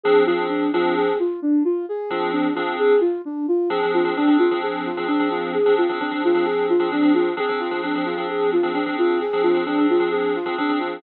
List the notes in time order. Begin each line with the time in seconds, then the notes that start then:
0.04 F3 C4 D4 G#4
0.26 F3 C4 D4 F4 G#4
0.50 D4
0.73 F3 C4 D4 F4 G#4
0.97 G#4
1.19 F4
1.42 D4
1.65 F4
1.89 G#4
2.10 F3 C4 D4 F4 G#4
2.32 D4
2.55 F3 C4 D4 F4 G#4
2.79 G#4
3.00 F4
3.25 D4
3.48 F4
3.70 F3 C4 D4 G#4
3.83 F3 C4 D4 G#4
3.94 F4
4.05 F3 C4 D4 G#4
4.16 F3 C4 D4 G#4
4.27 F3 C4 D4 G#4
4.39 F4
4.51 F3 C4 D4 G#4
4.62 G#4
4.86 F4
4.97 F3 C4 D4 G#4
5.08 F3 C4 D4 G#4
5.19 F3 C4 D4 G#4
5.31 F4
5.54 G#4
5.66 F3 C4 D4 G#4
5.78 F4
5.89 F3 C4 D4 G#4
6.00 F3 C4 D4 G#4
6.11 F3 C4 D4 G#4
6.24 F4
6.34 F3 C4 D4 G#4
6.45 G#4
6.69 F4
6.79 F3 C4 D4 G#4
6.92 F3 C4 D4 G#4
7.02 F3 C4 D4 G#4
7.14 F4
7.37 F3 C4 D4 G#4
7.49 F3 C4 D4 G#4
7.60 F4
7.71 F3 C4 D4 G#4
7.83 F3 C4 D4 G#4
7.95 F3 C4 D4 G#4
8.05 F4
8.17 F3 C4 D4 G#4
8.29 G#4
8.52 F4
8.63 F3 C4 D4 G#4
8.75 F3 C4 D4 G#4
8.86 F3 C4 D4 G#4
8.98 F4
9.21 G#4
9.33 F3 C4 D4 G#4
9.43 F4
9.54 F3 C4 D4 G#4
9.66 F3 C4 D4 G#4
9.78 F3 C4 D4 G#4
9.90 F4
10.00 F3 C4 D4 G#4
10.12 G#4
10.35 F4
10.46 F3 C4 D4 G#4
10.58 F3 C4 D4 G#4
10.69 F3 C4 D4 G#4
10.79 F4